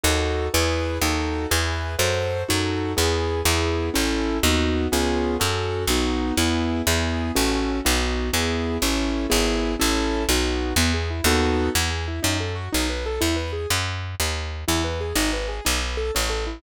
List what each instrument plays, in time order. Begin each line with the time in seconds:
0.04 electric bass (finger) D#2, acoustic grand piano D#4 F#4 A4
0.54 electric bass (finger) E2, acoustic grand piano E4 G#4 B4
1.01 electric bass (finger) D#2, acoustic grand piano D#4 F#4 A4
1.51 electric bass (finger) E2, acoustic grand piano E4 G#4 B4
1.99 electric bass (finger) F#2, acoustic grand piano F#4 A4 C5
2.49 electric bass (finger) F#2, acoustic grand piano D#4 F#4 A4
2.97 electric bass (finger) E2, acoustic grand piano B3 E4 G#4
3.45 electric bass (finger) E2, acoustic grand piano B3 E4 G#4
3.94 electric bass (finger) A1, acoustic grand piano C#4 E4 A4
4.43 electric bass (finger) D#2, acoustic grand piano B3 D#4 F#4
4.92 electric bass (finger) C#2, acoustic grand piano B3 C#4 F4 G#4
5.40 electric bass (finger) F#2, acoustic grand piano C#4 F#4 A4
5.87 electric bass (finger) B1, acoustic grand piano B3 D#4 F#4
6.37 electric bass (finger) E2, acoustic grand piano B3 E4 G#4
6.87 electric bass (finger) E2, acoustic grand piano B3 E4 G#4
7.36 electric bass (finger) A1, acoustic grand piano C#4 F#4 A4
7.85 electric bass (finger) B1, acoustic grand piano B3 D#4 F#4
8.33 electric bass (finger) E2, acoustic grand piano B3 E4 G#4
8.82 electric bass (finger) A1, acoustic grand piano C#4 E4 A4
9.30 electric bass (finger) G#1, acoustic grand piano B3 E4 G#4
9.80 electric bass (finger) A1, acoustic grand piano C#4 E4 A4
10.29 electric bass (finger) B1, acoustic grand piano B3 D#4 F#4
10.76 electric bass (finger) E2, acoustic grand piano B3
10.94 acoustic grand piano G#4
11.10 acoustic grand piano E4
11.24 electric bass (finger) D#2, acoustic grand piano B3 D#4 F#4 A4
11.75 electric bass (finger) E2, acoustic grand piano B3
11.91 acoustic grand piano G#4
12.08 acoustic grand piano E4
12.23 electric bass (finger) F#2, acoustic grand piano D#4
12.40 acoustic grand piano A4
12.55 acoustic grand piano F#4
12.72 electric bass (finger) B1, acoustic grand piano D#4
12.89 acoustic grand piano B4
13.06 acoustic grand piano A4
13.21 electric bass (finger) E2, acoustic grand piano E4
13.36 acoustic grand piano B4
13.53 acoustic grand piano G#4
13.70 electric bass (finger) F#2
14.20 electric bass (finger) D#2
14.68 electric bass (finger) E2, acoustic grand piano E4
14.84 acoustic grand piano B4
15.01 acoustic grand piano G#4
15.16 electric bass (finger) G#1, acoustic grand piano D#4
15.33 acoustic grand piano B4
15.48 acoustic grand piano G#4
15.65 electric bass (finger) B1, acoustic grand piano D#4
15.81 acoustic grand piano B4
15.97 acoustic grand piano A4
16.15 electric bass (finger) A1, acoustic grand piano C#4
16.30 acoustic grand piano A4
16.47 acoustic grand piano E4